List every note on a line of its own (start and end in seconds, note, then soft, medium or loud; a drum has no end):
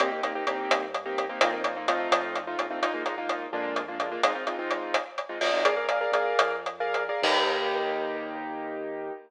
0.00 0.40 C2 medium
0.00 0.10 A#3 medium
0.00 0.10 C4 loud
0.00 0.10 D#4 medium
0.00 0.10 G4 medium
0.00 closed hi-hat loud
0.12 0.21 A#3 medium
0.12 0.21 C4 medium
0.12 0.21 D#4 medium
0.12 0.21 G4 medium
0.23 0.33 A#3 medium
0.23 0.33 C4 medium
0.23 0.33 D#4 medium
0.23 0.33 G4 medium
0.23 closed hi-hat medium
0.35 0.45 A#3 medium
0.35 0.45 C4 medium
0.35 0.45 D#4 medium
0.35 0.45 G4 medium
0.47 0.67 C2 medium
0.47 0.85 A#3 medium
0.47 0.85 C4 medium
0.47 0.85 D#4 medium
0.47 0.85 G4 medium
0.47 closed hi-hat medium
0.70 1.30 G2 medium
0.70 closed hi-hat loud
0.94 closed hi-hat medium
1.06 1.24 A#3 medium
1.06 1.24 C4 medium
1.06 1.24 D#4 medium
1.06 1.24 G4 medium
1.18 closed hi-hat medium
1.29 1.39 A#3 medium
1.29 1.39 C4 medium
1.29 1.39 D#4 medium
1.29 1.39 G4 medium
1.41 2.07 F2 medium
1.41 1.51 A#3 medium
1.41 1.51 C4 loud
1.41 1.51 D#4 medium
1.41 1.51 F4 loud
1.41 closed hi-hat loud
1.53 1.62 A#3 medium
1.53 1.62 C4 medium
1.53 1.62 D#4 medium
1.53 1.62 F4 medium
1.64 1.74 A#3 medium
1.64 1.74 C4 medium
1.64 1.74 D#4 medium
1.64 1.74 F4 medium
1.64 closed hi-hat medium
1.76 1.86 A#3 medium
1.76 1.86 C4 medium
1.76 1.86 D#4 medium
1.76 1.86 F4 medium
1.88 2.40 A3 medium
1.88 2.40 C4 medium
1.88 2.40 D#4 medium
1.88 2.40 F4 loud
1.88 closed hi-hat loud
2.11 2.56 F2 medium
2.11 closed hi-hat loud
2.35 closed hi-hat medium
2.47 2.66 A3 medium
2.47 2.66 C4 medium
2.47 2.66 D#4 medium
2.47 2.66 F4 medium
2.59 3.47 A#1 medium
2.59 closed hi-hat medium
2.71 2.80 A3 medium
2.71 2.80 C4 medium
2.71 2.80 D#4 medium
2.71 2.80 F4 medium
2.82 2.92 G#3 medium
2.82 2.92 A#3 medium
2.82 2.92 D#4 medium
2.82 2.92 F4 medium
2.82 closed hi-hat medium
2.94 3.03 G#3 medium
2.94 3.03 A#3 medium
2.94 3.03 D#4 medium
2.94 3.03 F4 medium
3.06 3.15 G#3 medium
3.06 3.15 A#3 medium
3.06 3.15 D#4 medium
3.06 3.15 F4 medium
3.06 closed hi-hat medium
3.18 3.46 G#3 medium
3.18 3.46 A#3 medium
3.18 3.46 D#4 medium
3.18 3.46 F4 medium
3.29 closed hi-hat medium
3.53 4.18 F2 medium
3.53 3.81 G#3 medium
3.53 3.81 A#3 medium
3.53 3.81 D4 medium
3.53 3.81 F4 medium
3.76 closed hi-hat medium
3.88 3.98 G#3 medium
3.88 3.98 A#3 medium
3.88 3.98 D4 medium
3.88 3.98 F4 medium
4.00 4.09 G#3 medium
4.00 4.09 A#3 medium
4.00 4.09 D4 medium
4.00 4.09 F4 medium
4.00 closed hi-hat medium
4.12 4.21 G#3 medium
4.12 4.21 A#3 medium
4.12 4.21 D4 medium
4.12 4.21 F4 medium
4.23 4.33 G#3 medium
4.23 4.33 C4 medium
4.23 4.33 D#4 medium
4.23 4.33 F4 medium
4.23 closed hi-hat loud
4.35 4.44 G#3 medium
4.35 4.44 C4 medium
4.35 4.44 D#4 medium
4.35 4.44 F4 medium
4.47 4.56 G#3 medium
4.47 4.56 C4 medium
4.47 4.56 D#4 medium
4.47 4.56 F4 medium
4.47 closed hi-hat medium
4.59 4.96 G#3 medium
4.59 4.96 C4 medium
4.59 4.96 D#4 medium
4.59 4.96 F4 medium
4.71 closed hi-hat medium
4.94 closed hi-hat loud
5.18 closed hi-hat medium
5.29 5.39 G#3 medium
5.29 5.39 C4 medium
5.29 5.39 D#4 medium
5.29 5.39 F4 medium
5.41 5.51 G#3 medium
5.41 5.51 C4 medium
5.41 5.51 D#4 medium
5.41 5.51 F4 medium
5.41 open hi-hat medium
5.53 5.63 G#3 medium
5.53 5.63 C4 medium
5.53 5.63 D#4 medium
5.53 5.63 F4 medium
5.65 6.07 A#1 medium
5.65 5.74 G#4 medium
5.65 5.74 A#4 medium
5.65 5.74 D5 medium
5.65 5.74 F5 medium
5.65 closed hi-hat loud
5.77 5.86 G#4 medium
5.77 5.86 A#4 medium
5.77 5.86 D5 medium
5.77 5.86 F5 medium
5.89 5.99 G#4 medium
5.89 5.99 A#4 medium
5.89 5.99 D5 medium
5.89 5.99 F5 medium
5.89 closed hi-hat medium
6.01 6.11 G#4 medium
6.01 6.11 A#4 medium
6.01 6.11 D5 medium
6.01 6.11 F5 medium
6.12 6.34 A#1 medium
6.12 6.56 G#4 medium
6.12 6.56 A#4 medium
6.12 6.56 D5 medium
6.12 6.56 F5 medium
6.12 closed hi-hat medium
6.39 7.10 F2 medium
6.39 closed hi-hat loud
6.66 closed hi-hat medium
6.80 7.03 G#4 medium
6.80 7.03 A#4 medium
6.80 7.03 D5 medium
6.80 7.03 F5 medium
6.94 closed hi-hat medium
7.09 7.21 G#4 medium
7.09 7.21 A#4 medium
7.09 7.21 D5 medium
7.09 7.21 F5 medium
7.22 9.11 D#2 loud
7.22 9.13 A#3 medium
7.22 9.13 D#4 loud
7.22 9.13 G4 loud
7.22 kick loud
7.22 crash loud